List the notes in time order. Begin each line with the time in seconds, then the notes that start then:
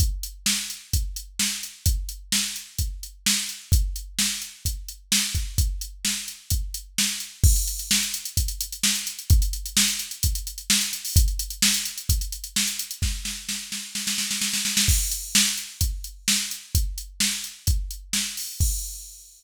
0.00 kick, closed hi-hat
0.23 closed hi-hat
0.46 snare
0.70 closed hi-hat
0.93 kick, closed hi-hat
1.16 closed hi-hat
1.39 snare
1.63 closed hi-hat
1.86 kick, closed hi-hat
2.09 closed hi-hat
2.32 snare
2.56 closed hi-hat
2.78 kick, closed hi-hat
3.03 closed hi-hat
3.26 snare
3.49 closed hi-hat
3.72 kick, closed hi-hat
3.96 closed hi-hat
4.19 snare
4.42 closed hi-hat
4.65 kick, closed hi-hat
4.88 closed hi-hat
5.12 snare
5.35 kick, closed hi-hat
5.58 kick, closed hi-hat
5.81 closed hi-hat
6.05 snare
6.28 closed hi-hat
6.50 kick, closed hi-hat
6.74 closed hi-hat
6.98 snare
7.20 closed hi-hat
7.44 kick, crash
7.56 closed hi-hat
7.67 closed hi-hat
7.79 closed hi-hat
7.91 snare
8.03 closed hi-hat
8.14 closed hi-hat
8.25 closed hi-hat
8.37 kick, closed hi-hat
8.48 closed hi-hat
8.61 closed hi-hat
8.72 closed hi-hat
8.83 snare
8.95 closed hi-hat
9.07 closed hi-hat
9.19 closed hi-hat
9.30 kick, closed hi-hat
9.42 closed hi-hat
9.53 closed hi-hat
9.66 closed hi-hat
9.77 snare
9.88 closed hi-hat
9.99 closed hi-hat
10.11 closed hi-hat
10.23 kick, closed hi-hat
10.35 closed hi-hat
10.47 closed hi-hat
10.58 closed hi-hat
10.70 snare
10.81 closed hi-hat
10.93 closed hi-hat
11.05 open hi-hat
11.16 kick, closed hi-hat
11.28 closed hi-hat
11.39 closed hi-hat
11.50 closed hi-hat
11.62 snare
11.74 closed hi-hat
11.85 closed hi-hat
11.98 closed hi-hat
12.09 kick, closed hi-hat
12.21 closed hi-hat
12.32 closed hi-hat
12.44 closed hi-hat
12.56 snare
12.67 closed hi-hat
12.79 closed hi-hat
12.91 closed hi-hat
13.02 kick, snare
13.25 snare
13.49 snare
13.72 snare
13.95 snare
14.07 snare
14.18 snare
14.31 snare
14.41 snare
14.53 snare
14.65 snare
14.77 snare
14.88 kick, crash
15.11 closed hi-hat
15.35 snare
15.57 closed hi-hat
15.81 kick, closed hi-hat
16.04 closed hi-hat
16.28 snare
16.51 closed hi-hat
16.75 kick, closed hi-hat
16.98 closed hi-hat
17.20 snare
17.44 closed hi-hat
17.67 kick, closed hi-hat
17.91 closed hi-hat
18.13 snare
18.37 open hi-hat
18.60 kick, crash